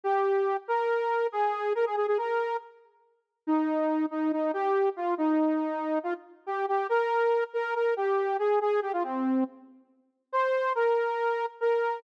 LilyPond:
\new Staff { \time 4/4 \key aes \major \tempo 4 = 140 g'4. bes'4. aes'4 | bes'16 aes'16 aes'16 aes'16 bes'4 r2 | ees'4. ees'8 ees'8 g'4 f'8 | ees'2 f'16 r8. g'8 g'8 |
bes'4. bes'8 bes'8 g'4 aes'8 | aes'8 g'16 f'16 c'4 r2 | c''4 bes'2 bes'4 | }